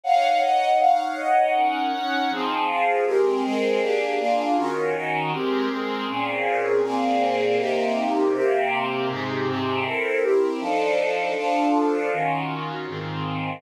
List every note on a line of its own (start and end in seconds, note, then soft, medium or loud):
0.04 0.41 D#4 medium
0.04 0.41 C#5 medium
0.04 0.41 F5 medium
0.04 0.41 F#5 medium
0.41 0.79 D#4 medium
0.41 0.79 C#5 medium
0.41 0.79 D#5 medium
0.41 0.79 F#5 medium
0.79 1.16 D#4 medium
0.79 1.16 C#5 medium
0.79 1.16 F5 medium
0.79 1.16 F#5 medium
1.17 1.54 D#4 medium
1.17 1.54 C#5 medium
1.17 1.54 D#5 medium
1.17 1.54 F#5 medium
1.54 1.92 C#4 medium
1.54 1.92 D#4 medium
1.54 1.92 A#4 medium
1.54 1.92 F#5 medium
1.92 2.29 C#4 medium
1.92 2.29 D#4 medium
1.92 2.29 C#5 medium
1.92 2.29 F#5 medium
2.30 2.67 F3 medium
2.30 2.67 C4 medium
2.30 2.67 D#4 medium
2.30 2.67 G#4 medium
2.68 3.05 F3 medium
2.68 3.05 C4 medium
2.68 3.05 F4 medium
2.68 3.05 G#4 medium
3.05 3.43 G#3 medium
3.05 3.43 C4 medium
3.05 3.43 G4 medium
3.05 3.43 A#4 medium
3.43 3.81 G#3 medium
3.43 3.81 C4 medium
3.43 3.80 G#4 medium
3.43 3.81 A#4 medium
3.81 4.18 A#3 medium
3.81 4.18 D4 medium
3.81 4.18 G4 medium
3.81 4.18 G#4 medium
4.19 4.56 A#3 medium
4.19 4.56 D4 medium
4.19 4.56 F4 medium
4.19 4.56 G#4 medium
4.56 4.94 D#3 medium
4.56 4.94 C#4 medium
4.56 4.94 F4 medium
4.56 4.94 F#4 medium
4.94 5.32 D#3 medium
4.94 5.32 C#4 medium
4.94 5.32 D#4 medium
4.94 5.32 F#4 medium
5.32 5.69 G#3 medium
5.32 5.69 C4 medium
5.32 5.69 G4 medium
5.32 5.69 A#4 medium
5.69 6.07 G#3 medium
5.69 6.07 C4 medium
5.69 6.07 G#4 medium
5.69 6.07 A#4 medium
6.07 6.82 A#2 medium
6.07 6.82 C4 medium
6.07 6.82 C#4 medium
6.07 6.82 G#4 medium
6.83 7.58 A#2 medium
6.83 7.58 A#3 medium
6.83 7.58 C4 medium
6.83 7.58 G#4 medium
7.58 8.33 C3 medium
7.58 8.33 A#3 medium
7.58 8.33 D#4 medium
7.58 8.33 G4 medium
8.34 9.08 C3 medium
8.34 9.08 A#3 medium
8.34 9.08 C4 medium
8.34 9.08 G4 medium
9.09 9.46 G#2 medium
9.09 9.46 C3 medium
9.09 9.47 D#4 medium
9.09 9.46 G4 medium
9.47 9.84 G#2 medium
9.47 9.84 C3 medium
9.47 9.84 C4 medium
9.47 9.84 G4 medium
9.85 10.22 C4 medium
9.85 10.22 E4 medium
9.85 10.22 A4 medium
9.85 10.22 A#4 medium
10.22 10.60 C4 medium
10.22 10.60 E4 medium
10.22 10.60 G4 medium
10.22 10.60 A#4 medium
10.60 11.35 F3 medium
10.60 11.35 D4 medium
10.60 11.35 D#4 medium
10.60 11.35 A4 medium
11.36 12.10 F3 medium
11.36 12.10 D4 medium
11.36 12.10 F4 medium
11.36 12.10 A4 medium
12.11 12.86 D#3 medium
12.11 12.86 C#4 medium
12.11 12.86 F4 medium
12.11 12.86 F#4 medium
12.87 13.61 G#2 medium
12.87 13.61 D#3 medium
12.87 13.61 C4 medium
12.87 13.61 F4 medium